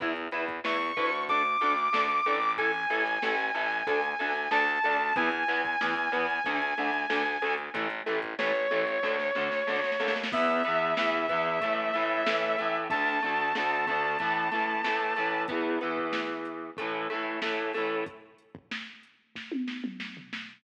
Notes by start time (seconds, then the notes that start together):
0.00 E2 E4 B4, kick, closed hi-hat
0.16 closed hi-hat
0.31 E2 E4 B4, closed hi-hat
0.48 kick, closed hi-hat
0.64 E2 E4 B4 C#6, snare
0.81 closed hi-hat
0.97 D2 E4 B4, kick, closed hi-hat
1.12 closed hi-hat
1.28 D4 A4 D6, kick, closed hi-hat
1.45 closed hi-hat
1.61 D2 D4 A4, closed hi-hat
1.78 closed hi-hat
1.93 D2 D4 A4, snare
2.10 closed hi-hat
2.26 A1 D4 A4, closed hi-hat
2.42 closed hi-hat
2.57 E4 A4 G#5, kick, closed hi-hat
2.74 closed hi-hat
2.90 A1 E4 A4, closed hi-hat
3.06 closed hi-hat
3.22 A1 E4 A4, snare
3.39 closed hi-hat
3.55 A1 E4 A4, closed hi-hat
3.72 closed hi-hat
3.87 D2 D4 A4, kick, closed hi-hat
4.04 closed hi-hat
4.19 D2 D4 A4, closed hi-hat
4.36 closed hi-hat
4.51 D2 D4 A4 A5, snare
4.67 closed hi-hat
4.84 D2 D4 A4, closed hi-hat
5.00 closed hi-hat
5.16 E2 E3 B3 G#5, kick, closed hi-hat
5.32 closed hi-hat
5.48 E2 E3 B3, closed hi-hat
5.65 kick, closed hi-hat
5.81 E2 E3 B3, snare
5.96 closed hi-hat
6.12 E2 E3 B3, closed hi-hat
6.30 closed hi-hat
6.44 D2 D3 A3, kick, closed hi-hat
6.62 closed hi-hat
6.77 D2 D3 A3, closed hi-hat
6.94 closed hi-hat
7.10 D2 D3 A3, snare
7.26 closed hi-hat
7.42 D2 D3 A3, closed hi-hat
7.58 closed hi-hat
7.74 A1 E3 A3, kick, closed hi-hat
7.90 closed hi-hat
8.06 A1 E3 A3, closed hi-hat
8.22 kick, closed hi-hat
8.39 A1 E3 A3 C#5, snare
8.55 closed hi-hat
8.71 A1 E3 A3, closed hi-hat
8.88 closed hi-hat
9.03 D2 D3 A3, kick, snare
9.19 snare
9.35 D2 D3 A3, snare
9.52 snare
9.67 D2 D3 A3, snare
9.76 snare
9.84 snare
9.92 snare
10.00 D#2 D3 A3, snare
10.08 snare
10.16 snare
10.24 snare
10.32 E2 E3 B3 E5, kick, crash
10.64 E3 B3, closed hi-hat
10.68 E2
10.97 E2 E3 B3, snare
11.29 E2 E3 B3, kick, closed hi-hat
11.61 A2 E3 A3, kick, closed hi-hat
11.94 A2 E3 A3, closed hi-hat
12.26 A2 E3 A3, snare
12.58 A2 E3 A3, closed hi-hat
12.90 D2 D3 A3 A5, kick, closed hi-hat
13.22 D2 D3 A3, closed hi-hat
13.55 D2 D3 A3, snare
13.87 D2 D3 A3, kick, closed hi-hat
14.19 E3 A3, kick, closed hi-hat
14.23 A2
14.51 A2 E3 A3, closed hi-hat
14.84 A2 E3 A3, snare
15.16 A2 E3 A3, closed hi-hat
15.48 E3 B3, kick, closed hi-hat
15.52 E2
15.81 E2 E3 B3, closed hi-hat
15.97 kick
16.13 snare
16.45 closed hi-hat
16.77 E3 A3, kick, closed hi-hat
16.81 A2
17.10 A2 E3 A3, closed hi-hat
17.42 A2 E3 A3, snare
17.73 E3 A3, open hi-hat
17.78 A2
18.06 kick, closed hi-hat
18.38 closed hi-hat
18.55 kick
18.71 snare
19.03 closed hi-hat
19.35 kick, snare
19.52 high tom
19.68 snare
19.84 mid tom
20.00 snare
20.17 floor tom
20.33 snare